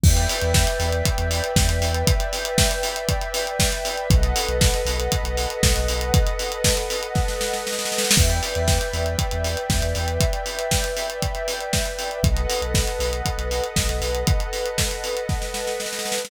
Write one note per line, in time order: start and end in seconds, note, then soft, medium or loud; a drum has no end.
0.03 0.27 E2 loud
0.03 4.07 B4 medium
0.03 4.07 D5 medium
0.03 4.07 E5 medium
0.03 4.07 G5 medium
0.03 kick loud
0.03 crash medium
0.17 closed hi-hat medium
0.29 open hi-hat medium
0.42 0.65 E2 loud
0.42 closed hi-hat medium
0.54 kick medium
0.54 snare medium
0.67 closed hi-hat medium
0.80 1.02 E2 medium
0.80 open hi-hat medium
0.92 closed hi-hat medium
1.05 kick medium
1.05 closed hi-hat medium
1.18 1.41 E2 medium
1.18 closed hi-hat medium
1.31 open hi-hat medium
1.44 closed hi-hat medium
1.56 1.67 E2 medium
1.56 kick medium
1.56 snare medium
1.68 1.80 E2 medium
1.68 closed hi-hat medium
1.81 2.04 E2 medium
1.81 open hi-hat medium
1.94 closed hi-hat medium
2.07 kick medium
2.07 closed hi-hat loud
2.20 closed hi-hat medium
2.33 open hi-hat medium
2.45 closed hi-hat medium
2.58 kick medium
2.58 snare loud
2.71 closed hi-hat medium
2.83 open hi-hat medium
2.96 closed hi-hat medium
3.09 kick medium
3.09 closed hi-hat medium
3.21 closed hi-hat medium
3.34 open hi-hat medium
3.47 closed hi-hat medium
3.60 kick medium
3.60 snare medium
3.72 closed hi-hat medium
3.85 open hi-hat medium
3.97 closed hi-hat medium
4.10 4.33 B1 loud
4.10 8.13 A4 medium
4.10 8.13 B4 medium
4.10 8.13 D#5 medium
4.10 8.13 F#5 medium
4.10 kick loud
4.10 closed hi-hat medium
4.23 closed hi-hat medium
4.36 open hi-hat medium
4.49 4.72 B1 medium
4.49 closed hi-hat medium
4.61 kick medium
4.61 snare medium
4.74 closed hi-hat medium
4.85 5.08 B1 medium
4.85 open hi-hat medium
5.00 closed hi-hat medium
5.12 kick medium
5.12 closed hi-hat medium
5.24 5.46 B1 medium
5.24 closed hi-hat medium
5.37 open hi-hat medium
5.50 closed hi-hat medium
5.63 5.74 B1 medium
5.63 kick medium
5.63 snare loud
5.76 5.88 B1 loud
5.76 closed hi-hat medium
5.88 6.11 B1 medium
5.88 open hi-hat medium
6.01 closed hi-hat medium
6.14 kick loud
6.14 closed hi-hat loud
6.27 closed hi-hat medium
6.39 open hi-hat medium
6.52 closed hi-hat medium
6.64 kick medium
6.64 snare loud
6.77 closed hi-hat medium
6.90 open hi-hat medium
7.03 closed hi-hat medium
7.15 kick medium
7.15 snare medium
7.28 snare medium
7.41 snare medium
7.53 snare medium
7.67 snare medium
7.72 snare medium
7.79 snare medium
7.85 snare medium
7.92 snare medium
7.98 snare medium
8.04 snare medium
8.11 snare loud
8.16 8.40 E2 medium
8.16 12.19 B4 medium
8.16 12.19 D5 medium
8.16 12.19 E5 medium
8.16 12.19 G5 medium
8.16 kick medium
8.16 crash medium
8.30 closed hi-hat medium
8.43 open hi-hat medium
8.55 8.79 E2 medium
8.55 closed hi-hat medium
8.68 kick medium
8.68 snare medium
8.81 closed hi-hat medium
8.93 9.16 E2 medium
8.93 open hi-hat medium
9.06 closed hi-hat medium
9.19 kick medium
9.19 closed hi-hat medium
9.31 9.56 E2 medium
9.31 closed hi-hat medium
9.44 open hi-hat medium
9.57 closed hi-hat medium
9.70 9.81 E2 medium
9.70 kick medium
9.70 snare medium
9.82 9.94 E2 medium
9.82 closed hi-hat medium
9.95 10.18 E2 medium
9.95 open hi-hat medium
10.08 closed hi-hat medium
10.20 kick medium
10.20 closed hi-hat medium
10.33 closed hi-hat medium
10.46 open hi-hat medium
10.59 closed hi-hat medium
10.71 kick medium
10.71 snare medium
10.84 closed hi-hat medium
10.97 open hi-hat medium
11.10 closed hi-hat medium
11.22 kick medium
11.22 closed hi-hat medium
11.35 closed hi-hat medium
11.48 open hi-hat medium
11.60 closed hi-hat medium
11.73 kick medium
11.73 snare medium
11.85 closed hi-hat medium
11.99 open hi-hat medium
12.11 closed hi-hat soft
12.23 12.46 B1 loud
12.23 16.28 A4 medium
12.23 16.28 B4 medium
12.23 16.28 D#5 medium
12.23 16.28 F#5 medium
12.23 kick medium
12.23 closed hi-hat medium
12.37 closed hi-hat medium
12.50 open hi-hat medium
12.62 12.85 B1 medium
12.62 closed hi-hat medium
12.74 kick medium
12.74 snare medium
12.88 closed hi-hat medium
12.99 13.22 B1 medium
12.99 open hi-hat medium
13.13 closed hi-hat medium
13.26 kick medium
13.26 closed hi-hat medium
13.38 13.61 B1 medium
13.38 closed hi-hat medium
13.51 open hi-hat medium
13.64 closed hi-hat medium
13.76 13.88 B1 medium
13.76 kick medium
13.76 snare medium
13.89 14.01 B1 medium
13.89 closed hi-hat medium
14.01 14.24 B1 medium
14.01 open hi-hat medium
14.15 closed hi-hat medium
14.27 kick medium
14.27 closed hi-hat medium
14.40 closed hi-hat medium
14.53 open hi-hat medium
14.66 closed hi-hat medium
14.78 kick medium
14.78 snare medium
14.91 closed hi-hat medium
15.04 open hi-hat medium
15.17 closed hi-hat medium
15.29 kick medium
15.29 snare soft
15.42 snare medium
15.54 snare medium
15.67 snare medium
15.80 snare medium
15.86 snare medium
15.93 snare medium
15.99 snare medium
16.05 snare medium
16.12 snare medium
16.18 snare medium
16.25 snare loud